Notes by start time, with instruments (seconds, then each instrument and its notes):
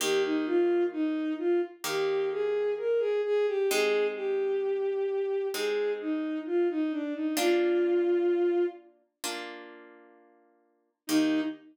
0.00 orchestral harp D#3 A#3 G4, violin G4
0.24 violin D#4
0.46 violin F4
0.92 violin D#4
1.38 violin F4
1.84 orchestral harp D#3 A#3 G4, violin G4
2.31 violin G#4
2.78 violin A#4
2.99 violin G#4
3.24 violin G#4
3.47 violin G4
3.70 orchestral harp G#3 C4 D#4, violin G#4
4.15 violin G4
5.54 orchestral harp G#3 C4 D#4, violin G#4
6.00 violin D#4
6.46 violin F4
6.70 violin D#4
6.92 violin D4
7.14 violin D#4
7.37 orchestral harp A#3 D4 F4, violin F4
9.24 orchestral harp A#3 D4 F4
11.07 orchestral harp D#3 A#3 G4, violin D#4